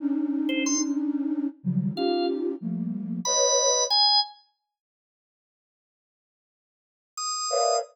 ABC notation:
X:1
M:6/8
L:1/16
Q:3/8=61
K:none
V:1 name="Flute"
[_D=D_E]10 [_D,_E,F,_G,=G,]2 | [_D_EFG]4 [F,G,A,_B,]4 [=B_d_e]4 | z12 | z10 [_B=B_d=def]2 |]
V:2 name="Drawbar Organ"
z3 c c' z7 | f2 z6 b4 | _a2 z10 | z8 _e'4 |]